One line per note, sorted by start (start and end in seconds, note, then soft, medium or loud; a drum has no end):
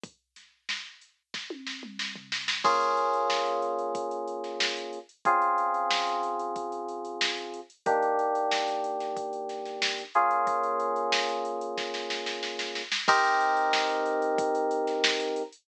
0.03 kick loud
0.03 closed hi-hat loud
0.36 snare soft
0.36 closed hi-hat medium
0.69 snare loud
1.01 closed hi-hat medium
1.34 kick medium
1.34 snare medium
1.50 high tom medium
1.67 snare medium
1.83 mid tom medium
1.99 snare loud
2.15 floor tom loud
2.32 snare loud
2.48 snare loud
2.64 4.99 A#3 medium
2.64 4.99 C#4 loud
2.64 4.99 F4 medium
2.64 4.99 G#4 medium
2.64 kick loud
2.64 crash loud
2.81 closed hi-hat medium
2.97 closed hi-hat medium
3.13 closed hi-hat medium
3.30 snare loud
3.46 closed hi-hat medium
3.62 closed hi-hat medium
3.79 closed hi-hat medium
3.95 kick loud
3.95 closed hi-hat loud
4.11 closed hi-hat medium
4.27 closed hi-hat medium
4.44 snare soft
4.44 closed hi-hat medium
4.60 snare loud
4.76 closed hi-hat medium
4.93 closed hi-hat medium
5.09 closed hi-hat medium
5.25 7.60 C#3 medium
5.25 7.60 C4 medium
5.25 7.60 F4 loud
5.25 7.60 G#4 medium
5.25 kick loud
5.25 closed hi-hat loud
5.42 closed hi-hat medium
5.58 closed hi-hat medium
5.74 closed hi-hat medium
5.90 snare loud
6.07 snare soft
6.07 closed hi-hat medium
6.23 closed hi-hat medium
6.39 closed hi-hat medium
6.56 kick medium
6.56 closed hi-hat loud
6.72 closed hi-hat medium
6.88 closed hi-hat medium
7.05 closed hi-hat medium
7.21 snare loud
7.37 closed hi-hat medium
7.54 closed hi-hat medium
7.70 closed hi-hat medium
7.86 10.03 D#3 medium
7.86 10.03 A#3 medium
7.86 10.03 D4 medium
7.86 10.03 G4 medium
7.86 kick loud
7.86 closed hi-hat loud
8.02 closed hi-hat medium
8.19 closed hi-hat medium
8.35 closed hi-hat medium
8.51 snare loud
8.68 snare soft
8.68 closed hi-hat medium
8.84 closed hi-hat medium
9.00 snare soft
9.00 closed hi-hat medium
9.16 kick medium
9.16 closed hi-hat loud
9.33 closed hi-hat medium
9.49 snare soft
9.49 closed hi-hat medium
9.65 snare soft
9.65 closed hi-hat medium
9.82 snare loud
9.98 closed hi-hat medium
10.14 12.82 A#3 medium
10.14 12.82 C#4 medium
10.14 12.82 F4 medium
10.14 12.82 G#4 medium
10.14 closed hi-hat medium
10.31 closed hi-hat medium
10.47 kick loud
10.47 closed hi-hat loud
10.63 closed hi-hat medium
10.80 closed hi-hat medium
10.96 closed hi-hat medium
11.12 snare loud
11.29 closed hi-hat medium
11.45 closed hi-hat medium
11.61 closed hi-hat medium
11.77 kick medium
11.77 snare medium
11.94 snare medium
12.10 snare medium
12.26 snare medium
12.43 snare medium
12.59 snare loud
12.75 snare medium
12.92 snare loud
13.08 15.43 C4 loud
13.08 15.43 D#4 loud
13.08 15.43 G4 loud
13.08 15.43 A#4 loud
13.08 kick loud
13.08 crash loud
13.24 closed hi-hat loud
13.40 closed hi-hat loud
13.57 closed hi-hat loud
13.73 snare loud
13.89 closed hi-hat medium
14.06 closed hi-hat loud
14.22 closed hi-hat medium
14.38 kick loud
14.38 closed hi-hat loud
14.55 closed hi-hat loud
14.71 closed hi-hat loud
14.87 snare medium
14.87 closed hi-hat medium
15.04 snare loud
15.20 closed hi-hat loud
15.36 closed hi-hat loud
15.52 closed hi-hat medium